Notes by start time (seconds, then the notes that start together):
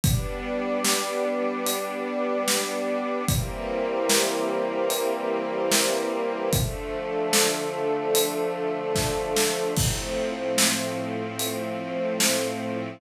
0.03 G3 B3 D4 G4 B4 D5, kick, closed hi-hat
0.84 snare
1.66 closed hi-hat
2.48 snare
3.28 E3 G3 A#3 C4 E4 G4 A#4 C5, kick, closed hi-hat
4.09 snare
4.90 closed hi-hat
5.71 snare
6.53 D3 F3 A3 D4 F4 A4, kick, closed hi-hat
7.33 snare
8.15 closed hi-hat
8.95 kick, snare
9.36 snare
9.77 A2 F3 A3 C4 F4, kick, crash
10.58 snare
11.39 closed hi-hat
12.20 snare